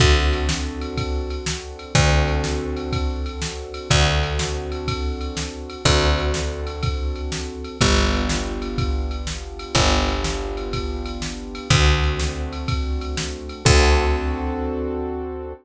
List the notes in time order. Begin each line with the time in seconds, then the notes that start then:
0.00 D2 C4 D4 F#4 A4, kick, crash
0.33 ride
0.49 snare
0.81 ride
0.97 kick, ride
1.30 ride
1.46 snare
1.79 ride
1.95 D2 C4 D4 F#4 A4, kick, ride
2.28 ride
2.44 snare
2.77 ride
2.92 kick, ride
3.26 ride
3.42 snare
3.74 ride
3.90 D2 C4 D4 F#4 A4, kick, ride
4.23 ride
4.39 snare
4.72 ride
4.88 kick, ride
5.21 ride
5.37 snare
5.70 ride
5.85 D2 C4 D4 F#4 A4, kick, ride
6.18 ride
6.34 snare
6.67 ride
6.83 kick, ride
7.16 ride
7.32 snare
7.64 ride
7.81 G1 B3 D4 F4 G4, kick, ride
8.13 ride
8.29 snare
8.62 ride
8.78 kick, ride
9.11 ride
9.27 snare
9.59 ride
9.75 G1 B3 D4 F4 G4, kick, ride
10.08 ride
10.24 snare
10.57 ride
10.73 kick, ride
11.06 ride
11.22 snare
11.55 ride
11.70 D2 A3 C4 D4 F#4, kick, ride
12.03 ride
12.19 snare
12.53 ride
12.68 kick, ride
13.01 ride
13.17 snare
13.49 ride
13.65 D2 C4 D4 F#4 A4, kick, crash